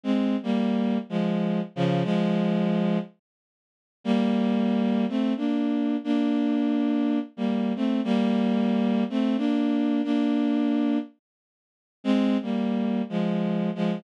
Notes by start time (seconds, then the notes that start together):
0.03 G#3 C4
0.43 G3 A#3
1.09 F3 G#3
1.76 C#3 F3
2.04 F3 G#3
4.04 G3 A#3
5.09 A3 C4
5.37 A#3 D4
6.04 A#3 D4
7.37 G3 A#3
7.76 A3 C4
8.04 G3 A#3
9.10 A3 C4
9.37 A#3 D4
10.04 A#3 D4
12.04 G#3 C4
12.42 G3 A#3
13.09 F3 G#3
13.75 F3 G#3